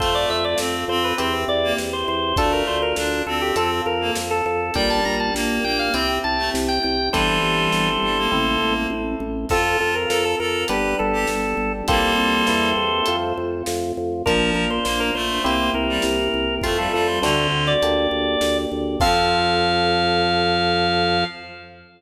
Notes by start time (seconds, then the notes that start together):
0.00 F2 A3 C4 F4 A4 C5, kick, closed hi-hat
0.15 D5
0.30 F2 E5
0.45 D5
0.58 F2 C4, snare
0.88 F2 C4 C5
1.04 B4
1.18 E2 C4 E4 G4 C5, closed hi-hat
1.48 E2 D5
1.64 A#3
1.78 E2, snare
1.93 C5
2.08 E2 C5
2.36 D2 A3 D4 F4 A4, kick, closed hi-hat
2.52 A#4
2.67 D2 C5
2.82 A#4
2.96 D2 D4, snare
3.26 D2 C4 A4
3.41 G4
3.56 F2 C4 F4 A4, closed hi-hat
3.86 F2 A#4
4.01 A#3
4.15 F2, snare
4.31 A4
4.46 F2 A4
4.74 A#1 G3 D4 G4 A#4 G5, kick, closed hi-hat
4.90 A5
5.05 A#1 A#5
5.20 A5
5.34 A#1 A#3, snare
5.64 A#1 A#3 G5
5.79 F5
5.94 C2 C4 E4 G4 G5, closed hi-hat
6.24 C2 A5
6.38 A3
6.54 C2, snare
6.68 G5
6.83 C2 G5
7.12 G1 E3 G3 C4 E4 G4 A4 C5, kick, closed hi-hat
7.43 G1
7.72 G1, snare
8.02 G1 G3
8.18 A#3
8.32 A1 C4 E4 A4, kick, floor tom
8.61 A1, mid tom
8.90 A1, high tom
9.20 A1
9.49 F2 C4 F4 A4, kick, crash
9.80 F2 A4
9.95 A#4
10.09 F2 A4 A#4, snare
10.25 A4
10.39 F2 A4 A#4
10.68 G1 B3 D4 G4 B4, closed hi-hat
10.99 G1 A4
11.13 G4
11.27 G1, snare
11.57 G1
11.88 C2 G3 A#3 C4 F4 G4 A4 C5, kick, closed hi-hat
12.18 C2
12.47 E2 A#3 C4 E4 G4, snare
12.76 E2
13.06 F2 A3 C4 F4, closed hi-hat
13.37 F2
13.66 F2, snare
13.97 F2
14.26 A#1 F3 A#3 D4 F4 A#4, kick, closed hi-hat
14.54 A#1 A#4
14.70 C5
14.85 A#1 A#3 C5, snare
15.00 A#4
15.14 A#1 A3 C5
15.44 C2 A#3 C4 E4 G4 C5, closed hi-hat
15.74 C2 A#4
15.89 G3
16.02 C2, snare
16.34 C2
16.62 F2 A3 C4 F4, kick, closed hi-hat
16.78 G3 A4
16.92 F2 G3 A4
17.08 C5
17.22 D2 D3 A3 C4 D4 F#4 C5, snare
17.52 D2
17.67 D5
17.82 D2 A#3 D4 G4, closed hi-hat
18.11 D2
18.41 D2, snare
18.72 D2
19.00 F2 F3 C4 F4 A4 F5, kick, crash